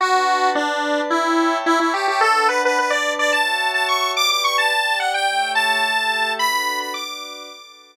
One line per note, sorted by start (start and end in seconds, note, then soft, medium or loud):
0.00 0.55 D4 medium
0.00 0.50 F#4 medium
0.00 0.55 B4 medium
0.00 0.55 F#5 medium
0.00 0.55 A5 medium
0.55 1.01 D4 medium
0.55 1.10 D4 medium
0.55 1.10 B4 medium
0.55 1.10 D5 medium
0.55 1.10 A5 medium
1.10 1.58 E4 medium
1.10 1.66 C#5 medium
1.10 1.66 E5 medium
1.10 1.66 G5 medium
1.10 1.66 A5 medium
1.66 1.79 E4 medium
1.66 2.22 C#5 medium
1.66 2.22 E5 medium
1.66 2.22 A5 medium
1.66 2.22 C#6 medium
1.80 1.93 E4 medium
1.94 2.07 G4 medium
2.08 2.21 G4 medium
2.21 2.77 D4 loud
2.21 2.47 A4 medium
2.21 2.77 B4 medium
2.21 2.77 F#5 medium
2.21 2.77 A5 medium
2.49 2.62 B4 medium
2.65 2.78 B4 medium
2.78 3.33 D4 medium
2.78 3.33 B4 medium
2.78 2.92 B4 medium
2.78 3.33 D5 medium
2.78 3.32 A5 medium
2.90 3.13 D5 medium
3.19 3.32 D5 medium
3.32 4.15 F#4 medium
3.32 4.15 C#5 medium
3.32 4.15 E5 medium
3.32 3.71 A5 medium
3.32 4.15 A5 medium
3.74 3.87 A5 medium
3.88 4.11 C#6 medium
4.16 4.71 G4 medium
4.16 4.71 B4 medium
4.16 4.71 D5 medium
4.16 4.29 D6 medium
4.30 4.43 D6 medium
4.44 4.57 C#6 medium
4.58 4.98 A5 medium
4.72 5.27 G4 medium
4.72 5.27 D5 medium
4.72 5.27 G5 loud
5.00 5.13 F#5 medium
5.14 5.52 G5 medium
5.28 5.83 A3 medium
5.28 5.83 G4 medium
5.28 5.83 C#5 medium
5.28 5.83 E5 medium
5.55 6.32 A5 medium
5.84 6.39 A3 medium
5.84 6.39 G4 medium
5.84 6.38 A4 medium
5.84 6.39 E5 medium
6.39 6.94 D4 medium
6.39 6.94 F#4 medium
6.39 6.94 A4 medium
6.39 6.94 B4 medium
6.39 6.79 B5 medium
6.80 6.93 B5 medium
6.94 7.49 D4 medium
6.94 7.49 F#4 medium
6.94 7.49 B4 medium
6.94 7.49 D5 medium
6.94 7.96 D6 medium
7.50 7.96 D4 medium
7.50 7.96 F#4 medium
7.50 7.96 A4 medium
7.50 7.96 B4 medium